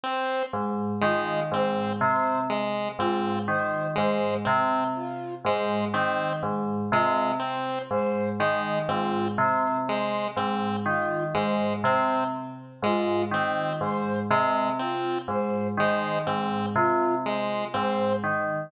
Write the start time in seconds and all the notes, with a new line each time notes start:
0.03 C4 C5
0.53 G#2
1.01 D#3 G#3 F4
1.52 G#2 C4 C5
2.01 C3 C5
2.50 G#3
2.99 G#2 C4 F4
3.48 D#3 C5
3.95 G#2 G#3 C5
4.45 C3 C4
4.95 F4
5.44 G#2 G#3 C5
5.94 D#3 C4 C5
6.43 G#2
6.92 C3 G#3 F4
7.40 C4 C5
7.90 G#2 C5
8.40 D#3 G#3
8.88 G#2 C4 F4
9.38 C3 C5
9.87 G#3 C5
10.37 G#2 C4
10.84 D#3 F4
11.34 G#2 G#3 C5
11.84 C3 C4 C5
12.83 G#2 G#3 F4
13.31 D#3 C4 C5
13.80 G#2 C5
14.31 C3 G#3
14.79 C4 F4
15.28 G#2 C5
15.77 D#3 G#3 C5
16.27 G#2 C4
16.75 C3 F4
17.24 G#3 C5
17.74 G#2 C4 C5
18.24 D#3